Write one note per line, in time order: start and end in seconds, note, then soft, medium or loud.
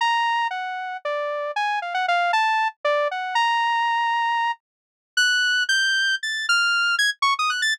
0.01 0.47 A#5 medium
0.51 0.97 F#5 medium
1.05 1.51 D5 medium
1.56 1.79 G#5 medium
1.82 1.94 F5 medium
1.94 2.06 F#5 medium
2.08 2.32 F5 loud
2.33 2.68 A5 loud
2.84 3.08 D5 loud
3.11 3.35 F#5 medium
3.35 4.52 A#5 loud
5.17 5.63 F#6 loud
5.69 6.15 G6 loud
6.23 6.46 A6 medium
6.49 6.95 F6 loud
6.99 7.10 G#6 loud
7.22 7.34 C#6 loud
7.39 7.50 D#6 medium
7.50 7.62 F#6 medium
7.62 7.74 A6 medium